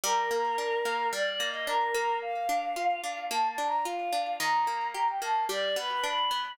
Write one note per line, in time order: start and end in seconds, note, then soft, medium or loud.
0.04 0.31 G3 loud
0.04 1.07 A#4 medium
0.31 0.58 A#3 medium
0.58 0.85 D4 medium
0.85 1.13 A#3 medium
1.12 1.40 G3 medium
1.12 1.30 D5 medium
1.31 1.48 D5 medium
1.40 1.67 A#3 medium
1.49 1.66 D#5 medium
1.67 1.95 D4 medium
1.67 2.16 A#4 loud
1.94 2.49 A#3 medium
2.22 3.25 F5 loud
2.49 2.76 D4 medium
2.76 3.04 F4 medium
3.04 3.31 D4 medium
3.30 3.58 A#3 medium
3.30 3.48 A5 medium
3.49 3.66 A5 medium
3.58 3.85 D4 medium
3.67 3.84 A#5 medium
3.85 4.13 F4 medium
3.85 4.35 F5 medium
4.13 4.38 D4 medium
4.40 4.67 D#3 medium
4.40 4.88 A#5 loud
4.67 4.94 A#3 medium
4.94 5.22 G4 medium
4.94 5.08 A#5 medium
5.08 5.21 G5 medium
5.21 5.48 A#3 medium
5.21 5.44 A5 medium
5.49 5.76 G3 loud
5.49 5.76 D5 medium
5.76 6.04 B3 medium
5.76 5.89 B4 medium
5.90 6.03 B4 medium
6.03 6.31 D4 medium
6.03 6.51 B5 medium
6.31 6.57 B3 medium